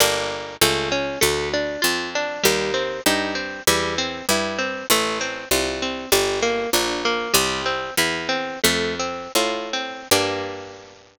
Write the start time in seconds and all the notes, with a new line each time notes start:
0.00 G1 A#3 D4 G4
0.61 C#2 A3
0.92 C#4
1.21 D2 A3
1.54 D4
1.82 F2 F4
2.15 D4
2.43 D#2 G3
2.74 C4
3.06 G2 D#4
3.35 C4
3.67 E2 G3
3.98 C4
4.29 G2 E4
4.58 C4
4.90 A1 A3
5.21 C4
5.51 C2 F4
5.82 C4
6.12 G1 G3
6.42 A#3
6.73 A#1 D4
7.05 A#3
7.34 C2 G3
7.66 C4
7.97 E2 E4
8.29 C4
8.64 F2 A3
8.99 C4
9.35 A2 F4
9.73 C4
10.11 G2 A#3 D4 G4